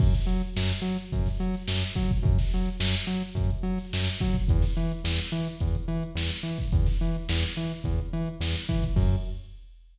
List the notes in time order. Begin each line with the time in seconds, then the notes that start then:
0.00 F#2, kick, crash
0.13 snare, closed hi-hat
0.26 F#3, closed hi-hat
0.43 closed hi-hat
0.56 F#2, snare
0.70 closed hi-hat
0.82 F#3, closed hi-hat
0.99 snare, closed hi-hat
1.13 F#2, kick, closed hi-hat
1.26 snare, closed hi-hat
1.40 F#3, closed hi-hat
1.54 snare, closed hi-hat
1.68 F#2, snare
1.83 closed hi-hat
1.96 F#3, kick, closed hi-hat
2.10 kick, closed hi-hat
2.22 F#2, kick, closed hi-hat
2.38 snare, closed hi-hat
2.52 F#3, snare, closed hi-hat
2.66 closed hi-hat
2.80 F#2, snare
2.94 closed hi-hat
3.07 F#3, closed hi-hat
3.22 closed hi-hat
3.35 F#2, kick, closed hi-hat
3.51 closed hi-hat
3.63 F#3, closed hi-hat
3.78 snare, closed hi-hat
3.93 F#2, snare
4.07 snare, closed hi-hat
4.20 F#3, kick, closed hi-hat
4.34 kick, closed hi-hat
4.48 E2, kick, closed hi-hat
4.62 snare, closed hi-hat
4.77 E3, closed hi-hat
4.91 closed hi-hat
5.04 E2, snare
5.19 closed hi-hat
5.32 E3, closed hi-hat
5.47 closed hi-hat
5.60 E2, kick, closed hi-hat
5.75 closed hi-hat
5.88 E3, closed hi-hat
6.03 closed hi-hat
6.15 E2, snare
6.31 closed hi-hat
6.43 E3, closed hi-hat
6.59 kick, open hi-hat
6.72 E2, kick, closed hi-hat
6.86 snare, closed hi-hat
7.01 E3, closed hi-hat
7.14 closed hi-hat
7.29 E2, snare
7.43 closed hi-hat
7.56 E3, closed hi-hat
7.71 closed hi-hat
7.84 E2, kick, closed hi-hat
7.98 closed hi-hat
8.13 E3, closed hi-hat
8.26 closed hi-hat
8.40 E2, snare
8.56 closed hi-hat
8.69 E3, kick, closed hi-hat
8.83 kick, closed hi-hat
8.96 F#2, kick, crash